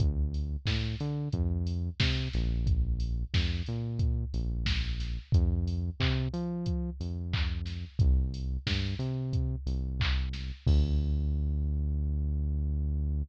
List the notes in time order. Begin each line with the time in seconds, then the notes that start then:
0.00 D2, kick, closed hi-hat
0.34 open hi-hat
0.66 A2, kick, snare
1.00 D3, open hi-hat
1.33 F2, kick, closed hi-hat
1.67 open hi-hat
2.00 C3, kick, snare
2.33 A#1, snare, open hi-hat
2.67 kick, closed hi-hat
3.00 open hi-hat
3.34 F2, kick, snare
3.66 A#2, open hi-hat
3.99 kick, closed hi-hat
4.33 A#1, open hi-hat
4.66 kick, snare
5.00 snare, open hi-hat
5.32 F2, kick, closed hi-hat
5.68 open hi-hat
6.00 C3, kick, clap
6.33 F3, open hi-hat
6.66 kick, closed hi-hat
7.00 F2, open hi-hat
7.33 kick, clap
7.66 snare, open hi-hat
7.99 C2, kick, closed hi-hat
8.34 open hi-hat
8.67 G2, kick, snare
8.99 C3, open hi-hat
9.33 kick, closed hi-hat
9.66 C2, open hi-hat
10.00 kick, clap
10.33 snare, open hi-hat
10.67 D2, kick, crash